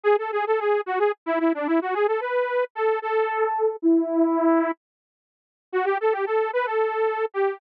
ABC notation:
X:1
M:7/8
L:1/16
Q:1/4=111
K:C#phr
V:1 name="Lead 2 (sawtooth)"
G A G A G2 F G z E E D E F | G A B4 A2 A6 | E8 z6 | [K:F#phr] F G A G A2 B A5 G2 |]